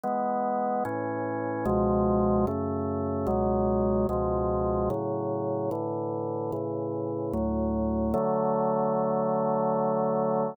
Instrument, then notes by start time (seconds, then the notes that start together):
drawbar organ
0.04 E3 G#3 B3
0.85 A2 E3 C#4
1.65 C#2 B2 F3 G#3
2.47 F#2 C#3 A3
3.27 C#2 B2 F#3 G#3
4.09 C#2 B2 F3 G#3
4.90 A2 C#3 F#3
5.71 A2 D3 E3
6.52 A2 C#3 E3
7.33 D2 A2 F#3
8.14 D3 F#3 A3